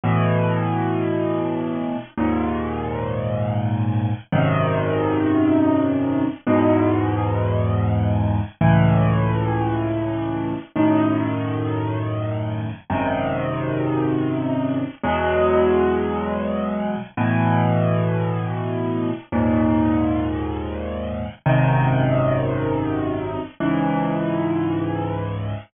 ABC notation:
X:1
M:6/8
L:1/8
Q:3/8=56
K:C#m
V:1 name="Acoustic Grand Piano" clef=bass
[A,,B,,E,]6 | [D,,G,,^A,,]6 | [G,,,F,,^B,,D,]6 | [E,,G,,B,,]6 |
[C,,A,,E,]6 | [F,,A,,D,]6 | [G,,,F,,^B,,D,]6 | [E,,B,,F,G,]6 |
[A,,B,,E,]6 | [D,,G,,^A,,]6 | [G,,,F,,^B,,D,]6 | [C,,G,,E,]6 |]